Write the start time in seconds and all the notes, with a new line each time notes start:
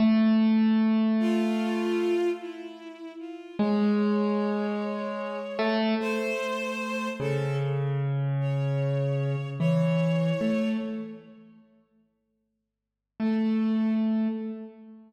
0.00 A3
1.20 F4
2.40 E4
3.19 F4
3.59 G#3 C#5
5.59 A3
6.00 A3 C5
7.20 C#3 A4
8.40 C#5
9.60 E3 C#5
10.41 A3
13.20 A3 A4